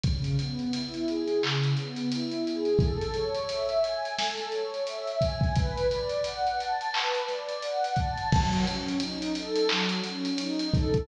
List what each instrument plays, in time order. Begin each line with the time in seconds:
0.03 pad 2 (warm) C#3, kick, closed hi-hat
0.24 closed hi-hat
0.39 pad 2 (warm) B3, closed hi-hat
0.59 closed hi-hat
0.73 pad 2 (warm) E4, closed hi-hat
0.94 closed hi-hat
1.08 pad 2 (warm) G#4, closed hi-hat
1.28 closed hi-hat
1.43 pad 2 (warm) C#3, clap
1.64 closed hi-hat
1.77 pad 2 (warm) B3, closed hi-hat
1.96 closed hi-hat
2.11 pad 2 (warm) E4, closed hi-hat
2.31 closed hi-hat
2.46 pad 2 (warm) G#4, closed hi-hat
2.65 closed hi-hat
2.79 pad 2 (warm) A4, kick, closed hi-hat
3.01 closed hi-hat
3.14 pad 2 (warm) C#5, closed hi-hat
3.34 closed hi-hat
3.49 pad 2 (warm) E5, closed hi-hat
3.69 closed hi-hat
3.84 pad 2 (warm) G#5, closed hi-hat
4.05 closed hi-hat
4.18 pad 2 (warm) A4, snare
4.37 snare, closed hi-hat
4.52 pad 2 (warm) C#5, closed hi-hat
4.74 closed hi-hat
4.87 pad 2 (warm) E5, closed hi-hat
5.07 closed hi-hat
5.21 pad 2 (warm) G#5, kick, closed hi-hat
5.41 kick, closed hi-hat
5.55 pad 2 (warm) B4, kick, closed hi-hat
5.77 closed hi-hat
5.91 pad 2 (warm) D5, closed hi-hat
6.09 closed hi-hat
6.24 pad 2 (warm) F#5, closed hi-hat
6.47 closed hi-hat
6.59 pad 2 (warm) A5, closed hi-hat
6.81 closed hi-hat
6.93 pad 2 (warm) B4, clap
7.14 closed hi-hat
7.28 pad 2 (warm) D5, snare, closed hi-hat
7.49 closed hi-hat
7.62 pad 2 (warm) F#5, closed hi-hat
7.84 closed hi-hat
7.96 pad 2 (warm) A5, kick, closed hi-hat
8.18 closed hi-hat
8.32 pad 2 (warm) F#3, kick, crash
8.53 closed hi-hat
8.66 pad 2 (warm) C#4, closed hi-hat
8.88 closed hi-hat
9.00 pad 2 (warm) D#4, closed hi-hat
9.22 closed hi-hat
9.35 pad 2 (warm) A4, closed hi-hat
9.56 closed hi-hat
9.69 pad 2 (warm) F#3, clap
9.89 closed hi-hat
10.04 pad 2 (warm) C#4, closed hi-hat
10.25 closed hi-hat
10.38 pad 2 (warm) D#4, closed hi-hat
10.59 closed hi-hat
10.73 pad 2 (warm) A4, kick, closed hi-hat
10.94 kick, closed hi-hat